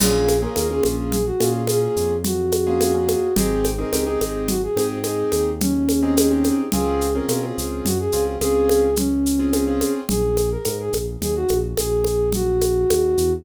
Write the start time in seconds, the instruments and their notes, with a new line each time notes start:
0.00 synth bass 1 A#1, acoustic grand piano A#3 C#4 F4 G#4, flute G#4, crash, low conga, shaker
0.28 high conga, shaker
0.42 acoustic grand piano A#3 C#4 F4 G#4, flute A#4
0.56 synth bass 1 D#2, acoustic grand piano A#3 C#4 F4 G#4, flute A#4, high conga, shaker
0.70 acoustic grand piano A#3 C#4 F4 G#4, flute G#4
0.83 synth bass 1 A#1, high conga, shaker
1.12 flute G#4, low conga, shaker
1.26 flute F#4
1.40 synth bass 1 A#2, acoustic grand piano A#3 C#4 F4 G#4, high conga, shaker
1.67 acoustic grand piano A#3 C#4 F4 G#4, flute G#4, high conga, shaker
1.96 synth bass 1 F2, shaker
2.24 flute F#4, low conga, shaker
2.52 high conga, shaker
2.67 acoustic grand piano A#3 C#4 F4 G#4
2.80 acoustic grand piano A#3 C#4 F4 G#4, high conga, shaker
2.94 acoustic grand piano A#3 C#4 F4 G#4
3.08 high conga, shaker
3.36 synth bass 1 G#1, acoustic grand piano C4 D#4 G4 G#4, flute G#4, low conga, shaker
3.64 high conga, shaker
3.79 acoustic grand piano C4 D#4 G4 G#4, flute A#4
3.92 synth bass 1 C#2, acoustic grand piano C4 D#4 G4 G#4, flute A#4, high conga, shaker
4.06 acoustic grand piano C4 D#4 G4 G#4, flute G#4
4.21 synth bass 1 G#1, high conga, shaker
4.48 flute F#4, low conga, shaker
4.63 flute G#4
4.76 synth bass 1 G#2, acoustic grand piano C4 D#4 G4 G#4, high conga, shaker
5.04 acoustic grand piano C4 D#4 G4 G#4, flute G#4, high conga, shaker
5.32 synth bass 1 D#2, high conga, shaker
5.61 flute C#4, low conga, shaker
5.89 high conga, shaker
6.03 acoustic grand piano C4 D#4 G4 G#4
6.17 acoustic grand piano C4 D#4 G4 G#4, high conga, shaker
6.31 acoustic grand piano C4 D#4 G4 G#4
6.44 high conga, shaker
6.72 synth bass 1 C#2, acoustic grand piano C4 C#4 F4 G#4, flute G#4, low conga, shaker
7.01 shaker
7.15 acoustic grand piano C4 C#4 F4 G#4, flute A#4
7.28 synth bass 1 B2, acoustic grand piano C4 C#4 F4 G#4, flute A#4, high conga, shaker
7.43 acoustic grand piano C4 C#4 F4 G#4, flute G#4
7.58 synth bass 1 C#2, shaker
7.85 synth bass 1 F#2, flute F#4, low conga, shaker
7.99 flute G#4
8.12 synth bass 1 C#2, acoustic grand piano C4 C#4 F4 G#4, shaker
8.41 synth bass 1 C#2, acoustic grand piano C4 C#4 F4 G#4, flute G#4, high conga, shaker
8.69 high conga, shaker
8.96 flute C#4, low conga, shaker
9.26 shaker
9.39 acoustic grand piano C4 C#4 F4 G#4
9.53 acoustic grand piano C4 C#4 F4 G#4, high conga, shaker
9.67 acoustic grand piano C4 C#4 F4 G#4
9.81 high conga, shaker
10.09 synth bass 1 A#1, flute G#4, low conga, shaker
10.37 high conga, shaker
10.51 flute A#4
10.65 synth bass 1 G#2, flute A#4, high conga, shaker
10.80 flute G#4
10.93 synth bass 1 A#1, high conga, shaker
11.21 synth bass 1 D#2, flute G#4, low conga, shaker
11.35 flute F#4
11.48 synth bass 1 A#1, high conga, shaker
11.77 synth bass 1 A#1, flute G#4, high conga, shaker
12.04 high conga, shaker
12.32 flute F#4, low conga, shaker
12.61 high conga, shaker
12.90 synth bass 1 D#2, high conga, shaker
13.18 synth bass 1 E2, shaker